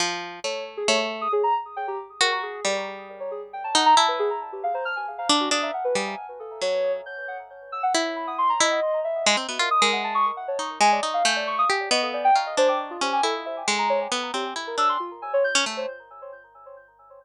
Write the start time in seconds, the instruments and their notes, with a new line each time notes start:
0.00 orchestral harp F3
0.44 orchestral harp A3, ocarina C#5
0.77 ocarina G#4
0.88 orchestral harp A3, ocarina C#5
1.21 ocarina D#6
1.32 ocarina G#4
1.43 ocarina A#5
1.76 ocarina G5
1.88 ocarina G4
2.21 orchestral harp F#4, ocarina A#4
2.32 ocarina C#6
2.43 ocarina G#4
2.65 orchestral harp G3, ocarina D5
3.20 ocarina C#5
3.31 ocarina G#4
3.53 ocarina G5
3.64 ocarina A5
3.75 orchestral harp D#4, ocarina F#5
3.86 ocarina A#5
3.97 orchestral harp E4, ocarina A5
4.08 ocarina B4
4.19 ocarina G#4
4.52 ocarina G4
4.63 ocarina F5
4.74 ocarina C5
4.85 ocarina F6
4.96 ocarina G#5
5.18 ocarina F5
5.29 orchestral harp D4
5.40 ocarina F#4
5.51 orchestral harp D4, ocarina D#6
5.62 ocarina E5
5.74 ocarina F#5
5.84 ocarina B4
5.95 orchestral harp G3, ocarina G#5
6.40 ocarina A4
6.61 orchestral harp F#3, ocarina C#5
7.06 ocarina G6
7.28 ocarina F#5
7.72 ocarina E6
7.83 ocarina F#5
7.94 orchestral harp E4
8.16 ocarina B5
8.27 ocarina D#6
8.38 ocarina C6
8.49 ocarina A#5
8.60 orchestral harp E4, ocarina D#5
9.04 ocarina E5
9.26 orchestral harp G#3
9.37 orchestral harp C4
9.49 orchestral harp B3, ocarina F#4
9.59 orchestral harp F4, ocarina A#4
9.71 ocarina D#6
9.82 orchestral harp G#3, ocarina A#4
9.93 ocarina F#5
10.04 ocarina A5
10.15 ocarina C#6
10.37 ocarina F#5
10.48 ocarina C#5
10.59 orchestral harp D#4
10.81 orchestral harp G#3, ocarina G#5
10.92 ocarina D5
11.03 orchestral harp D#4
11.14 ocarina F5
11.25 orchestral harp A3, ocarina G6
11.36 ocarina D5
11.47 ocarina C#6
11.58 ocarina D#6
11.70 orchestral harp G4
11.91 orchestral harp B3, ocarina D#5
12.02 ocarina A4
12.14 ocarina D5
12.24 ocarina G5
12.35 orchestral harp F4, ocarina A#5
12.46 ocarina D#5
12.57 orchestral harp D4, ocarina C5
12.68 ocarina D6
12.90 ocarina F4
13.01 orchestral harp C#4, ocarina G4
13.13 ocarina G#5
13.23 orchestral harp E4, ocarina A4
13.46 ocarina E5
13.68 orchestral harp G#3
13.79 ocarina A#5
13.90 ocarina C#5
14.12 orchestral harp B3
14.34 orchestral harp C4, ocarina G4
14.56 orchestral harp E4
14.67 ocarina A#4
14.78 orchestral harp D4, ocarina E6
14.89 ocarina C6
15.00 ocarina F4
15.22 ocarina G#5
15.33 ocarina C#5
15.44 ocarina G6
15.55 orchestral harp C#4
15.66 orchestral harp A3
15.77 ocarina C5